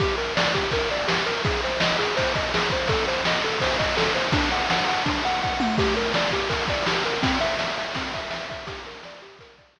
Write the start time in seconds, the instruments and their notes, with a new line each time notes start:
0.00 lead 1 (square) G4, kick, ride
0.18 lead 1 (square) A#4, ride
0.37 lead 1 (square) D5, snare
0.54 lead 1 (square) G4, kick, ride
0.71 lead 1 (square) A#4, kick, ride
0.90 lead 1 (square) D5, ride
1.08 lead 1 (square) G4, snare
1.26 lead 1 (square) A#4, ride
1.45 lead 1 (square) G#4, kick, ride
1.63 lead 1 (square) C5, ride
1.80 lead 1 (square) D#5, snare
1.99 lead 1 (square) G#4, ride
2.17 lead 1 (square) C5, kick, ride
2.34 lead 1 (square) D#5, kick, ride
2.54 lead 1 (square) G#4, snare
2.70 lead 1 (square) C5, kick, ride
2.88 lead 1 (square) A4, kick, ride
3.07 lead 1 (square) C5, ride
3.25 lead 1 (square) D#5, snare
3.43 lead 1 (square) A4, ride
3.60 lead 1 (square) C5, kick, ride
3.79 lead 1 (square) D#5, kick, ride
3.97 lead 1 (square) A4, snare
4.15 lead 1 (square) C5, ride
4.32 lead 1 (square) D4, kick, ride
4.51 lead 1 (square) F#5, ride
4.70 lead 1 (square) F#5, snare
4.88 lead 1 (square) F#5, ride
5.06 lead 1 (square) D4, kick, ride
5.25 lead 1 (square) F#5, ride
5.43 lead 1 (square) F#5, kick
5.60 lead 1 (square) F#5, high tom
5.78 lead 1 (square) G4, kick, crash
5.97 lead 1 (square) A#4, ride
6.14 lead 1 (square) D5, snare
6.31 lead 1 (square) G4, kick, ride
6.49 lead 1 (square) A#4, kick, ride
6.68 lead 1 (square) D5, kick, ride
6.86 lead 1 (square) G4, snare
7.04 lead 1 (square) A#4, ride
7.23 lead 1 (square) C4, kick, ride
7.41 lead 1 (square) E5, ride
7.59 lead 1 (square) E5, snare
7.77 lead 1 (square) E5, ride
7.94 lead 1 (square) C4, kick, ride
8.14 lead 1 (square) E5, kick, ride
8.30 lead 1 (square) E5, snare
8.49 lead 1 (square) E5, kick, ride
8.67 lead 1 (square) G4, kick, ride
8.85 lead 1 (square) A#4, ride
9.03 lead 1 (square) D5, snare
9.21 lead 1 (square) G4, ride
9.39 lead 1 (square) A#4, kick, ride
9.58 lead 1 (square) D5, kick, ride
9.76 lead 1 (square) G4, snare